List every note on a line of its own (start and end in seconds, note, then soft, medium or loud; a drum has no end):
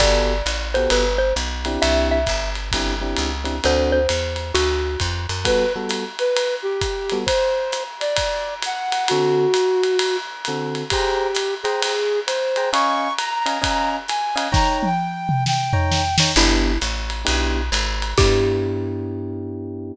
0.00 0.42 G1 loud
0.00 0.34 B3 medium
0.00 0.34 F#4 medium
0.00 0.34 G4 medium
0.00 0.34 A4 loud
0.00 0.69 D5 medium
0.00 kick medium
0.00 crash loud
0.00 ride loud
0.46 0.88 A1 medium
0.46 hi-hat pedal medium
0.46 ride medium
0.74 1.05 B3 medium
0.74 1.05 F#4 medium
0.74 1.05 G4 medium
0.74 1.05 A4 medium
0.74 0.91 C5 medium
0.74 ride medium
0.90 1.33 G1 medium
0.90 1.19 B4 medium
0.90 ride loud
1.18 1.34 C5 medium
1.36 1.78 B1 medium
1.36 hi-hat pedal loud
1.36 ride medium
1.65 2.18 C4 medium
1.65 2.18 D4 loud
1.65 2.18 E4 loud
1.65 2.18 G4 loud
1.65 ride medium
1.82 2.25 C2 loud
1.82 2.08 E5 medium
1.82 ride loud
2.11 2.50 E5 medium
2.26 2.71 G1 medium
2.26 kick medium
2.26 hi-hat pedal medium
2.26 ride medium
2.55 ride medium
2.72 3.15 G1 medium
2.72 2.94 C4 medium
2.72 2.94 D4 medium
2.72 2.94 E4 medium
2.72 2.94 G4 medium
2.72 kick medium
2.72 ride loud
3.01 3.30 C4 medium
3.01 3.30 D4 medium
3.01 3.30 E4 medium
3.01 3.30 G4 medium
3.16 3.60 C#2 medium
3.16 hi-hat pedal medium
3.16 ride medium
3.44 3.56 C4 medium
3.44 3.56 D4 medium
3.44 3.56 E4 medium
3.44 3.56 G4 medium
3.44 ride medium
3.64 4.07 D2 medium
3.64 3.99 C4 loud
3.64 3.99 D4 loud
3.64 3.99 F#4 medium
3.64 3.99 A4 loud
3.64 3.92 C5 medium
3.64 ride loud
3.92 4.52 C5 medium
4.09 4.52 E2 medium
4.09 hi-hat pedal medium
4.09 ride loud
4.36 ride medium
4.54 4.97 D2 medium
4.54 4.99 F#4 medium
4.54 ride loud
5.00 5.27 F2 medium
5.00 kick medium
5.00 hi-hat pedal medium
5.00 ride medium
5.29 5.45 F#2 medium
5.29 ride medium
5.45 5.64 G3 medium
5.45 5.64 B3 loud
5.45 5.64 F#4 loud
5.45 5.64 A4 loud
5.45 5.73 B4 loud
5.45 kick medium
5.45 ride loud
5.76 6.04 G3 medium
5.76 6.04 B3 medium
5.76 6.04 F#4 medium
5.76 6.04 A4 loud
5.89 hi-hat pedal medium
5.89 ride loud
6.19 6.55 B4 medium
6.19 ride medium
6.37 ride loud
6.63 7.18 G4 loud
6.81 kick medium
6.81 hi-hat pedal medium
6.81 ride medium
7.10 7.24 G3 medium
7.10 7.24 B3 loud
7.10 7.24 F#4 loud
7.10 7.24 A4 medium
7.10 ride medium
7.26 7.83 C5 loud
7.26 kick medium
7.26 ride loud
7.72 hi-hat pedal loud
7.72 ride medium
8.00 8.55 D5 medium
8.00 ride medium
8.16 kick medium
8.16 ride loud
8.62 9.08 F#5 loud
8.62 hi-hat pedal medium
8.62 ride loud
8.92 ride medium
9.08 9.46 D3 loud
9.08 9.46 C4 medium
9.08 10.17 F#4 loud
9.08 9.46 F#4 loud
9.08 9.46 A4 loud
9.08 ride loud
9.54 hi-hat pedal loud
9.54 ride loud
9.84 ride medium
9.99 ride loud
10.45 10.83 D3 loud
10.45 10.83 C4 medium
10.45 10.83 F#4 medium
10.45 10.83 A4 medium
10.45 hi-hat pedal medium
10.45 ride medium
10.75 ride medium
10.90 11.54 G4 loud
10.90 11.27 G#4 loud
10.90 11.27 C5 loud
10.90 11.27 G5 loud
10.90 11.27 A#5 loud
10.90 kick medium
10.90 ride loud
11.35 hi-hat pedal loud
11.35 ride loud
11.63 12.20 G#4 medium
11.63 11.93 G#4 medium
11.63 11.93 C5 loud
11.63 11.93 G5 medium
11.63 11.93 A#5 medium
11.63 ride medium
11.82 ride loud
12.27 12.70 C5 medium
12.27 hi-hat pedal loud
12.27 ride loud
12.56 12.69 G#4 medium
12.56 12.69 C5 medium
12.56 12.69 G5 medium
12.56 12.69 A#5 medium
12.56 ride medium
12.73 13.08 C#4 loud
12.73 13.08 D#5 loud
12.73 13.08 F5 loud
12.73 13.08 G#5 loud
12.73 13.13 C#6 loud
12.73 ride loud
13.18 13.96 A#5 loud
13.18 hi-hat pedal medium
13.18 ride loud
13.46 13.57 C#4 medium
13.46 13.57 D#5 medium
13.46 13.57 F5 medium
13.46 13.57 G#5 medium
13.46 ride medium
13.62 13.97 C#4 loud
13.62 13.97 D#5 medium
13.62 13.97 F5 medium
13.62 13.97 G#5 medium
13.62 kick medium
13.62 ride loud
14.08 14.48 G#5 loud
14.08 hi-hat pedal medium
14.08 ride medium
14.36 14.48 C#4 medium
14.36 14.48 D#5 loud
14.36 14.48 F5 loud
14.36 14.48 G#5 loud
14.36 ride loud
14.52 14.87 D#4 loud
14.52 14.87 C#5 loud
14.52 14.87 G5 loud
14.52 14.87 A#5 loud
14.52 14.78 A#5 loud
14.52 kick loud
14.52 snare loud
14.83 15.44 G5 medium
14.83 high tom medium
15.29 mid tom loud
15.46 16.16 G5 loud
15.46 snare loud
15.73 16.02 D#4 medium
15.73 16.02 C#5 loud
15.73 16.02 G5 loud
15.73 16.02 A#5 medium
15.73 floor tom loud
15.92 snare loud
16.18 16.31 D#4 medium
16.18 16.31 C#5 loud
16.18 16.31 G5 medium
16.18 16.31 A#5 medium
16.18 snare loud
16.36 16.78 G1 loud
16.36 16.72 B3 loud
16.36 16.72 D4 loud
16.36 16.72 E4 loud
16.36 16.79 E4 medium
16.36 16.72 G4 loud
16.36 crash loud
16.36 ride medium
16.81 17.24 A1 medium
16.81 hi-hat pedal loud
16.81 ride medium
17.10 ride medium
17.25 17.70 B1 loud
17.25 17.60 B3 medium
17.25 17.60 D4 medium
17.25 17.60 E4 medium
17.25 17.60 G4 loud
17.25 ride loud
17.72 18.14 G#1 loud
17.72 hi-hat pedal loud
17.72 ride loud
18.02 ride medium
18.18 19.92 G2 medium
18.18 19.93 B3 medium
18.18 19.93 D4 medium
18.18 19.93 E4 medium
18.18 19.92 G4 loud
18.18 19.93 G4 loud
18.18 kick loud
18.18 crash loud